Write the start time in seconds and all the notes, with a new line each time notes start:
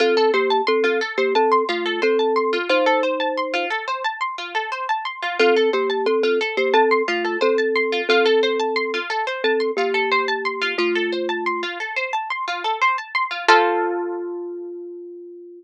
0.00 C4 F4 A4
0.17 A4
0.34 A#3 G4 C5
0.50 A5
0.67 C4 A4 C6
0.84 C4 F4 A4
1.01 A4
1.18 A#3 G4 C5
1.35 C4 A4 A5
1.52 C6
1.69 A3 F4
1.86 A4
2.02 C4 A4 C5
2.19 A5
2.36 C6
2.53 F4
2.69 D#4 F4 C5
2.86 A4
3.03 C5
3.20 A5
3.37 C6
3.54 F4
3.70 A4
3.88 C5
4.04 A5
4.21 C6
4.38 F4
4.55 A4
4.72 C5
4.89 A5
5.05 C6
5.22 F4
5.39 C4 F4 A4
5.56 A4
5.73 A#3 G4 C5
5.90 A5
6.06 C4 A4 C6
6.23 C4 F4 A4
6.41 A4
6.57 A#3 G4 C5
6.74 C4 A4 A5
6.91 C6
7.08 A3 F4
7.25 A4
7.41 C4 A4 C5
7.58 A5
7.76 C6
7.92 F4
8.09 C4 F4 A4
8.26 A4
8.43 C5
8.60 A5
8.76 C6
8.94 F4
9.10 A4
9.27 C5
9.44 C4 A4 A5
9.60 C6
9.77 A#3 F4 G4
9.94 A4
10.12 C5
10.28 A5
10.45 C6
10.62 F4
10.78 A3 F4
10.95 A4
11.12 C5
11.29 A5
11.46 C6
11.63 F4
11.80 A4
11.96 C5
12.13 A5
12.30 C6
12.48 F4
12.64 A4
12.81 C5
12.98 A5
13.15 C6
13.31 F4
13.48 F4 A4 C5